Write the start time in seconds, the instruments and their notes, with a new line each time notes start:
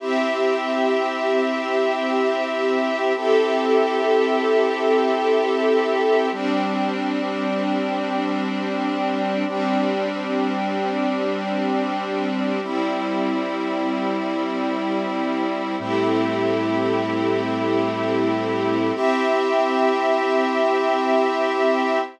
0.00 string ensemble 1 C4 G4 E5, brass section C4 E4 G4
3.15 brass section C4 E4 G4 A4, string ensemble 1 C4 G4 A4 E5
6.32 brass section G3 C4 D4, string ensemble 1 G3 C4 D4
9.47 brass section G3 C4 D4, string ensemble 1 G3 C4 D4
12.62 brass section G3 C4 E4, string ensemble 1 G3 C4 E4
15.79 brass section A2 G3 C4 E4, string ensemble 1 A3 C4 E4 G4
18.95 string ensemble 1 C4 G4 E5, brass section C4 E4 G4